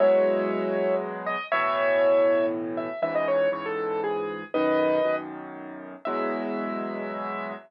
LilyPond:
<<
  \new Staff \with { instrumentName = "Acoustic Grand Piano" } { \time 3/4 \key e \major \tempo 4 = 119 <cis'' e''>2 r8 dis''8 | <cis'' e''>2 r8 e''8 | e''16 dis''16 cis''8 cis''16 a'8. gis'4 | <b' dis''>4. r4. |
e''2. | }
  \new Staff \with { instrumentName = "Acoustic Grand Piano" } { \clef bass \time 3/4 \key e \major <e, b, fis gis>2. | <a, b, e>2. | <cis, gis, e>4 <cis, gis, e>2 | <b,, fis, dis>4 <b,, fis, dis>2 |
<e, b, fis gis>2. | }
>>